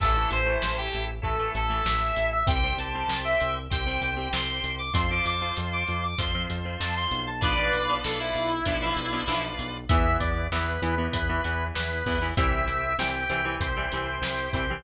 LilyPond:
<<
  \new Staff \with { instrumentName = "Distortion Guitar" } { \time 4/4 \key a \minor \tempo 4 = 97 a'8 c''8. g'8 r16 a'8 a'8 e''8. e''16 | g''8 a''8. e''8 r16 g''8 g''8 c'''8. d'''16 | c'''16 d'''16 d'''8 r16 d'''8 d'''16 c'''8 r8 a''16 c'''8 a''16 | <b' d''>4 a'16 e'2~ e'16 r8 |
\key e \minor r1 | r1 | }
  \new Staff \with { instrumentName = "Drawbar Organ" } { \time 4/4 \key a \minor r1 | r1 | r1 | r1 |
\key e \minor e''8 d''8 b'4 b'4 b'4 | e''4 g''4 c''4. c''8 | }
  \new Staff \with { instrumentName = "Acoustic Guitar (steel)" } { \time 4/4 \key a \minor <e a>16 <e a>8 <e a>4~ <e a>16 <e a>16 <e a>8 <e a>16 <e a>4 | <g c'>16 <g c'>8 <g c'>4~ <g c'>16 <g c'>16 <g c'>8 <g c'>16 <g c'>4 | <f c'>16 <f c'>8 <f c'>4~ <f c'>16 <f c'>16 <f c'>8 <f c'>16 <f c'>4 | <f b d'>16 <f b d'>8 <f b d'>4~ <f b d'>16 <f b d'>16 <f b d'>8 <f b d'>16 <f b d'>4 |
\key e \minor <e b>4 <e b>8 <e b>16 <e b>8 <e b>16 <e b>4 <e b>16 <e b>16 | <e g c'>4 <e g c'>8 <e g c'>16 <e g c'>8 <e g c'>16 <e g c'>4 <e g c'>16 <e g c'>16 | }
  \new Staff \with { instrumentName = "Drawbar Organ" } { \time 4/4 \key a \minor <e' a'>2 <e' a'>2 | <g' c''>2 <g' c''>2 | <f' c''>2 <f' c''>2 | <f' b' d''>2 <f' b' d''>2 |
\key e \minor <b e'>4 <b e'>4 <b e'>4 <b e'>4 | <c' e' g'>4 <c' e' g'>4 <c' e' g'>4 <c' e' g'>4 | }
  \new Staff \with { instrumentName = "Synth Bass 1" } { \clef bass \time 4/4 \key a \minor a,,8 a,,8 a,,8 a,,8 a,,8 a,,8 a,,8 a,,8 | c,8 c,8 c,8 c,8 c,8 c,8 c,8 c,8 | f,8 f,8 f,8 f,8 f,8 f,8 f,8 b,,8~ | b,,8 b,,8 b,,8 b,,8 b,,8 b,,8 b,,8 b,,8 |
\key e \minor e,8 e,8 e,8 e,8 e,8 e,8 e,8 e,8 | c,8 c,8 c,8 c,8 c,8 c,8 c,8 c,8 | }
  \new DrumStaff \with { instrumentName = "Drums" } \drummode { \time 4/4 <cymc bd>8 hh8 sn8 hh8 bd8 hh8 sn8 hh8 | <hh bd>8 hh8 sn8 hh8 <hh bd>8 hh8 sn8 hh8 | <hh bd>8 hh8 hh8 hh8 <hh bd>8 hh8 sn8 hh8 | <hh bd>8 hh8 sn8 hh8 <hh bd>8 hh8 sn8 hh8 |
<hh bd>8 <hh bd>8 sn8 hh8 <hh bd>8 hh8 sn8 <hho bd>8 | <hh bd>8 hh8 sn8 hh8 <hh bd>8 hh8 sn8 <hh bd>8 | }
>>